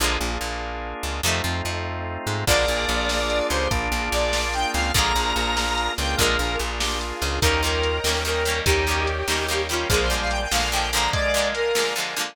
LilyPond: <<
  \new Staff \with { instrumentName = "Lead 1 (square)" } { \time 6/8 \key bes \mixolydian \tempo 4. = 97 r2. | r2. | d''2~ d''8 c''8 | r4 d''4 g''8 f''8 |
bes''2~ bes''8 g''8 | bes'4 r2 | bes'8 bes'4. bes'4 | g'2~ g'8 f'8 |
aes'16 c''16 c''16 f''16 g''16 g''16 f''8 g''8 bes''8 | d''4 bes'4 r4 | }
  \new Staff \with { instrumentName = "Drawbar Organ" } { \time 6/8 \key bes \mixolydian r2. | r2. | bes'2~ bes'8 g'8 | d'2~ d'8 c'8 |
bes'2. | bes'4 r8 g'8 r4 | ees'8 f'4 r4. | ees'4 r2 |
f8 g4 r4. | aes4 r2 | }
  \new Staff \with { instrumentName = "Acoustic Guitar (steel)" } { \time 6/8 \key bes \mixolydian <d f aes bes>8 bes,8 bes,4. des8 | <c ees f a>8 f8 f4. aes8 | <d f aes bes>8 bes,8 bes,4. des8 | r8 bes,8 bes,4. des8 |
<d f aes bes>8 bes,8 bes,4. des8 | <d f aes bes>8 bes,8 bes,4. des8 | <ees g bes des'>8 <ees g bes des'>4 <ees g bes des'>8 <ees g bes des'>8 <ees g bes des'>8 | <ees g bes des'>8 <ees g bes des'>4 <ees g bes des'>8 <ees g bes des'>8 <ees g bes des'>8 |
<d f aes bes>8 <d f aes bes>4 <d f aes bes>8 <d f aes bes>8 <d f aes bes>8~ | <d f aes bes>8 <d f aes bes>4 <d f aes bes>8 <d f aes bes>8 <d f aes bes>8 | }
  \new Staff \with { instrumentName = "Drawbar Organ" } { \time 6/8 \key bes \mixolydian <bes d' f' aes'>2. | <a c' ees' f'>2. | <bes d' f' aes'>2. | <bes d' f' aes'>2. |
<bes d' f' aes'>2~ <bes d' f' aes'>8 <bes d' f' aes'>8~ | <bes d' f' aes'>2. | r2. | r2. |
r2. | r2. | }
  \new Staff \with { instrumentName = "Electric Bass (finger)" } { \clef bass \time 6/8 \key bes \mixolydian bes,,8 bes,,8 bes,,4. des,8 | f,8 f,8 f,4. aes,8 | bes,,8 bes,,8 bes,,4. des,8 | bes,,8 bes,,8 bes,,4. des,8 |
bes,,8 bes,,8 bes,,4. des,8 | bes,,8 bes,,8 bes,,4. des,8 | ees,4. ees,4. | ees,4. ees,4. |
bes,,4. bes,,4. | r2. | }
  \new Staff \with { instrumentName = "String Ensemble 1" } { \time 6/8 \key bes \mixolydian r2. | r2. | <bes d' f' aes'>2. | <bes d' f' aes'>2. |
<bes d' f' aes'>2. | <bes d' f' aes'>2. | <bes' des'' ees'' g''>2. | <bes' des'' ees'' g''>2. |
<bes' d'' f'' aes''>2. | <bes' d'' f'' aes''>2. | }
  \new DrumStaff \with { instrumentName = "Drums" } \drummode { \time 6/8 r4. r4. | r4. r4. | <cymc bd>8 hh8 hh8 sn8 hh8 hh8 | <hh bd>8 hh8 hh8 sn8 hh8 hh8 |
<hh bd>8 hh8 hh8 sn8 hh8 hh8 | <hh bd>8 hh8 hh8 sn8 hh8 hho8 | <hh bd>8 hh8 hh8 sn8 hh8 hh8 | <hh bd>8 hh8 hh8 sn8 hh8 hh8 |
<hh bd>8 hh8 hh8 sn8 hh8 hh8 | <hh bd>8 hh8 hh8 sn8 hh8 hh8 | }
>>